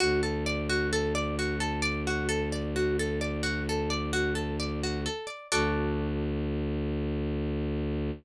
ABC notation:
X:1
M:12/8
L:1/8
Q:3/8=87
K:Dmix
V:1 name="Pizzicato Strings"
F A d F A d F A d F A d | F A d F A d F A d F A d | [FAd]12 |]
V:2 name="Violin" clef=bass
D,,12- | D,,12 | D,,12 |]